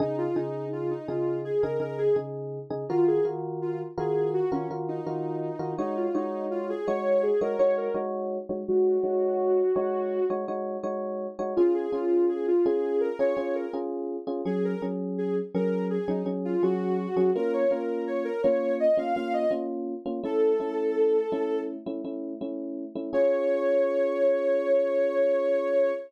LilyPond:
<<
  \new Staff \with { instrumentName = "Ocarina" } { \time 4/4 \key des \major \tempo 4 = 83 ees'16 f'16 ees'8 f'16 ees'16 f'8 aes'16 bes'16 bes'16 aes'16 r4 | f'16 aes'16 r8 f'16 r16 aes'8 ges'16 des'16 r16 ees'16 ees'4 | ees'16 f'16 ees'8 f'16 aes'16 des''8 aes'16 bes'16 des''16 bes'16 r4 | ges'2~ ges'8 r4. |
f'16 aes'16 f'8 aes'16 f'16 aes'8 bes'16 des''16 des''16 bes'16 r4 | aes'16 bes'16 r8 aes'16 r16 bes'8 aes'16 ees'16 r16 f'16 ges'4 | bes'16 des''16 bes'8 des''16 bes'16 des''8 ees''16 f''16 f''16 ees''16 r4 | a'2 r2 |
des''1 | }
  \new Staff \with { instrumentName = "Electric Piano 1" } { \time 4/4 \key des \major <des ees' aes'>8 <des ees' aes'>4 <des ees' aes'>8. <des ees' aes'>16 <des ees' aes'>8 <des ees' aes'>8. <des ees' aes'>16 | <ees f' ges' bes'>8 <ees f' ges' bes'>4 <ees f' ges' bes'>8. <ees f' ges' bes'>16 <ees f' ges' bes'>8 <ees f' ges' bes'>8. <ees f' ges' bes'>16 | <aes ees' ges' des''>8 <aes ees' ges' des''>4 <aes ees' ges' des''>8. <aes ees' ges' des''>16 <aes ees' ges' des''>8 <aes ees' ges' des''>8. <aes ees' ges' des''>16 | <aes ees' ges' des''>8 <aes ees' ges' des''>4 <aes ees' ges' des''>8. <aes ees' ges' des''>16 <aes ees' ges' des''>8 <aes ees' ges' des''>8. <aes ees' ges' des''>16 |
<des' f' aes'>8 <des' f' aes'>4 <des' f' aes'>8. <des' f' aes'>16 <des' f' aes'>8 <des' f' aes'>8. <des' f' aes'>16 | <ges des' aes'>8 <ges des' aes'>4 <ges des' aes'>8. <ges des' aes'>16 <ges des' aes'>8 <ges des' aes'>8. <ges des' aes'>16 | <bes des' f'>8 <bes des' f'>4 <bes des' f'>8. <bes des' f'>16 <bes des' f'>8 <bes des' f'>8. <bes des' f'>16 | <a cis' e'>8 <a cis' e'>4 <a cis' e'>8. <a cis' e'>16 <a cis' e'>8 <a cis' e'>8. <a cis' e'>16 |
<des' f' aes'>1 | }
>>